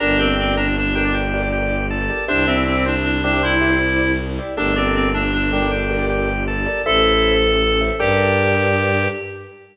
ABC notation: X:1
M:6/8
L:1/16
Q:3/8=105
K:Gdor
V:1 name="Clarinet"
D2 C2 C2 D2 D2 D2 | z12 | D2 C2 C2 D2 D2 D2 | E8 z4 |
D2 C2 C2 D2 D2 D2 | z12 | A10 z2 | G12 |]
V:2 name="Drawbar Organ"
B2 g4 B z3 G D | G4 G4 A4 | C2 E4 C z3 G, G, | C4 z8 |
A,2 D4 A, z3 G, G, | G4 G4 A4 | E6 z6 | G12 |]
V:3 name="Acoustic Grand Piano"
[GBd]2 [GBd] [GBd]7 [GBd]2- | [GBd]2 [GBd] [GBd]7 [GBd]2 | [Gcde]2 [Gcde] [Gcde]7 [Gcde]2- | [Gcde]2 [Gcde] [Gcde]7 [Gcde]2 |
[GABd]2 [GABd] [GABd]7 [GABd]2- | [GABd]2 [GABd] [GABd]7 [GABd]2 | [Ace]2 [Ace] [Ace]7 [Ace]2 | [GABd]12 |]
V:4 name="Violin" clef=bass
G,,,12- | G,,,12 | C,,12- | C,,12 |
G,,,12- | G,,,12 | A,,,12 | G,,12 |]